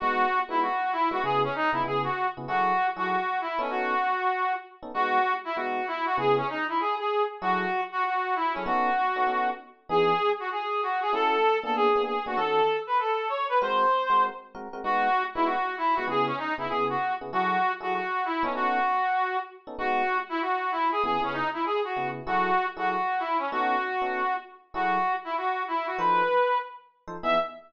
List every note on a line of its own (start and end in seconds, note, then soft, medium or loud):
0.00 0.25 G#3 loud
0.00 0.25 B3 loud
0.00 0.25 D#4 loud
0.00 0.39 F#4 loud
0.00 0.25 F#4 medium
0.49 0.68 G#3 medium
0.49 0.68 B3 medium
0.49 0.68 D#4 medium
0.49 0.60 E4 medium
0.49 0.68 F#4 medium
0.62 0.92 F#4 medium
0.92 1.09 E4 medium
1.11 1.20 G#3 medium
1.11 1.20 B3 medium
1.11 1.20 D#4 medium
1.11 1.20 F#4 medium
1.11 1.22 F#4 medium
1.23 1.47 C#3 loud
1.23 1.47 B3 loud
1.23 1.47 E4 loud
1.23 1.47 G#4 medium
1.23 1.41 G#4 medium
1.44 1.54 C#4 medium
1.55 1.70 D#4 medium
1.73 1.81 C#3 medium
1.73 1.81 B3 medium
1.73 1.81 E4 medium
1.73 1.83 E4 medium
1.73 1.81 G#4 medium
1.84 2.07 C#3 medium
1.84 2.07 B3 medium
1.84 2.07 E4 medium
1.84 2.07 G#4 medium
1.84 2.02 G#4 medium
2.04 2.27 F#4 medium
2.37 2.46 C#3 medium
2.37 2.46 B3 medium
2.37 2.46 E4 medium
2.37 2.46 G#4 medium
2.48 2.72 F#3 medium
2.48 2.72 E4 medium
2.48 2.87 F#4 medium
2.48 2.72 G#4 medium
2.48 2.72 A4 medium
2.96 3.16 F#3 medium
2.96 3.16 E4 medium
2.96 3.08 F#4 medium
2.96 3.16 G#4 medium
2.96 3.16 A4 medium
3.09 3.39 F#4 medium
3.41 3.59 E4 medium
3.59 3.94 B3 medium
3.59 3.94 C#4 loud
3.59 3.70 C#4 medium
3.59 3.94 D#4 loud
3.59 3.94 A4 loud
3.70 4.52 F#4 medium
4.83 4.91 B3 medium
4.83 4.91 C#4 medium
4.83 4.91 D#4 medium
4.83 4.91 A4 medium
4.94 5.19 G#3 loud
4.94 5.19 B3 medium
4.94 5.19 D#4 medium
4.94 5.33 F#4 loud
4.94 5.19 F#4 medium
5.45 5.55 E4 medium
5.56 5.80 G#3 medium
5.56 5.80 B3 medium
5.56 5.80 D#4 medium
5.56 5.86 F#4 medium
5.56 5.80 F#4 medium
5.87 6.04 E4 medium
6.06 6.16 F#4 medium
6.17 6.41 C#3 medium
6.17 6.41 B3 loud
6.17 6.41 E4 loud
6.17 6.41 G#4 medium
6.17 6.35 G#4 medium
6.37 6.47 C#4 medium
6.50 6.65 D#4 medium
6.69 6.78 E4 medium
6.80 6.95 G#4 medium
6.99 7.23 G#4 medium
7.41 7.65 F#3 loud
7.41 7.65 E4 medium
7.41 7.81 F#4 medium
7.41 7.65 G#4 medium
7.41 7.65 A4 medium
7.92 8.03 F#4 medium
8.05 8.35 F#4 medium
8.35 8.53 E4 medium
8.53 8.64 F#3 medium
8.53 8.64 C#4 medium
8.53 8.64 E4 medium
8.53 8.64 G#4 medium
8.53 8.64 A4 medium
8.66 8.90 B3 loud
8.66 8.90 C#4 medium
8.66 8.90 D#4 loud
8.66 9.48 F#4 medium
8.66 8.90 A4 loud
9.16 9.24 B3 medium
9.16 9.24 C#4 medium
9.16 9.24 D#4 medium
9.16 9.24 A4 medium
9.27 9.51 B3 medium
9.27 9.51 C#4 medium
9.27 9.51 D#4 medium
9.27 9.51 A4 medium
9.89 10.13 E3 loud
9.89 10.13 B3 medium
9.89 10.13 D#4 medium
9.89 10.13 G#4 medium
9.89 10.30 G#4 loud
10.40 10.49 F#4 medium
10.51 10.81 G#4 medium
10.83 11.00 F#4 medium
11.02 11.12 G#4 medium
11.13 11.37 A3 medium
11.13 11.37 C#4 loud
11.13 11.37 E4 loud
11.13 11.37 F#4 medium
11.13 11.57 A4 loud
11.63 11.89 A#3 loud
11.63 11.89 B3 medium
11.63 11.89 D4 medium
11.63 11.89 G#4 medium
11.63 11.74 A4 medium
11.76 12.02 G#4 medium
11.96 12.15 A#3 medium
11.96 12.15 B3 medium
11.96 12.15 D4 medium
11.96 12.15 G#4 medium
12.06 12.23 G#4 medium
12.26 12.35 A#3 medium
12.26 12.35 B3 medium
12.26 12.35 D4 medium
12.26 12.38 F#4 medium
12.26 12.35 G#4 medium
12.37 12.61 D#3 loud
12.37 12.61 C#4 medium
12.37 12.61 F#4 medium
12.37 12.77 A4 medium
12.37 12.61 A4 loud
12.87 12.98 B4 medium
12.99 13.28 A4 medium
13.29 13.46 C#5 medium
13.49 13.59 B4 medium
13.62 13.85 G#3 medium
13.62 13.85 C4 loud
13.62 13.85 F#4 medium
13.62 13.85 A#4 loud
13.62 14.23 C5 medium
14.10 14.29 G#3 medium
14.10 14.29 C4 medium
14.10 14.29 F#4 medium
14.10 14.29 A#4 medium
14.55 14.68 G#3 medium
14.55 14.68 C4 medium
14.55 14.68 F#4 medium
14.55 14.68 A#4 medium
14.73 14.82 G#3 medium
14.73 14.82 C4 medium
14.73 14.82 F#4 medium
14.73 14.82 A#4 medium
14.84 15.08 G#3 loud
14.84 15.08 B3 loud
14.84 15.08 D#4 loud
14.84 15.23 F#4 loud
14.84 15.08 F#4 medium
15.35 15.55 G#3 medium
15.35 15.55 B3 medium
15.35 15.55 D#4 medium
15.35 15.45 E4 medium
15.35 15.55 F#4 medium
15.45 15.76 F#4 medium
15.78 15.95 E4 medium
15.95 16.06 G#3 medium
15.95 16.06 B3 medium
15.95 16.06 D#4 medium
15.95 16.06 F#4 medium
16.07 16.31 C#3 loud
16.07 16.31 B3 loud
16.07 16.31 E4 loud
16.07 16.31 G#4 medium
16.07 16.26 G#4 medium
16.26 16.37 C#4 medium
16.38 16.54 D#4 medium
16.58 16.67 C#3 medium
16.58 16.67 B3 medium
16.58 16.67 E4 medium
16.58 16.68 E4 medium
16.58 16.67 G#4 medium
16.69 16.95 C#3 medium
16.69 16.95 B3 medium
16.69 16.95 E4 medium
16.69 16.84 G#4 medium
16.69 16.95 G#4 medium
16.89 17.13 F#4 medium
17.21 17.30 C#3 medium
17.21 17.30 B3 medium
17.21 17.30 E4 medium
17.21 17.30 G#4 medium
17.32 17.57 F#3 medium
17.32 17.57 E4 medium
17.32 17.72 F#4 medium
17.32 17.57 G#4 medium
17.32 17.57 A4 medium
17.80 18.00 F#3 medium
17.80 18.00 E4 medium
17.80 17.94 F#4 medium
17.80 18.00 G#4 medium
17.80 18.00 A4 medium
17.94 18.24 F#4 medium
18.25 18.43 E4 medium
18.43 18.79 B3 medium
18.43 18.79 C#4 loud
18.43 18.53 C#4 medium
18.43 18.79 D#4 loud
18.43 18.79 A4 loud
18.55 19.37 F#4 medium
19.67 19.76 B3 medium
19.67 19.76 C#4 medium
19.67 19.76 D#4 medium
19.67 19.76 A4 medium
19.78 20.02 G#3 loud
19.78 20.02 B3 medium
19.78 20.02 D#4 medium
19.78 20.18 F#4 loud
19.78 20.02 F#4 medium
20.29 20.40 E4 medium
20.41 20.72 F#4 medium
20.72 20.88 E4 medium
20.92 21.02 G#4 medium
21.04 21.17 C#3 medium
21.04 21.17 B3 loud
21.04 21.17 E4 loud
21.04 21.17 G#4 medium
21.04 21.21 G#4 medium
21.21 21.41 C#3 medium
21.21 21.41 B3 medium
21.21 21.33 C#4 medium
21.21 21.41 E4 medium
21.21 21.41 G#4 medium
21.33 21.48 D#4 medium
21.53 21.63 E4 medium
21.65 21.80 G#4 medium
21.84 22.08 F#4 medium
21.96 22.20 C#3 medium
21.96 22.20 B3 medium
21.96 22.20 E4 medium
21.96 22.20 G#4 medium
22.26 22.50 F#3 medium
22.26 22.50 E4 loud
22.26 22.66 F#4 medium
22.26 22.50 G#4 medium
22.26 22.50 A4 loud
22.77 22.96 F#3 medium
22.77 22.96 E4 medium
22.77 22.89 F#4 medium
22.77 22.96 G#4 medium
22.77 22.96 A4 medium
22.89 23.19 F#4 medium
23.19 23.37 E4 medium
23.38 23.48 C#4 medium
23.51 23.76 B3 medium
23.51 23.76 C#4 loud
23.51 23.76 D#4 loud
23.51 24.34 F#4 medium
23.51 23.76 A4 loud
24.02 24.21 B3 medium
24.02 24.21 C#4 medium
24.02 24.21 D#4 medium
24.02 24.21 A4 medium
24.74 24.98 F#3 loud
24.74 24.98 E4 loud
24.74 25.13 F#4 medium
24.74 24.98 G#4 medium
24.74 24.98 A4 medium
25.24 25.34 E4 medium
25.37 25.63 F#4 medium
25.68 25.86 E4 medium
25.87 25.98 F#4 medium
25.98 26.22 F3 loud
25.98 26.22 D#4 medium
25.98 26.22 A4 medium
25.98 26.58 B4 medium
25.98 26.22 C5 loud
27.08 27.16 F3 medium
27.08 27.16 D#4 medium
27.08 27.16 A4 medium
27.08 27.16 C5 medium
27.23 27.36 E3 medium
27.23 27.36 B3 loud
27.23 27.36 D#4 loud
27.23 27.36 G#4 loud
27.23 27.36 E5 loud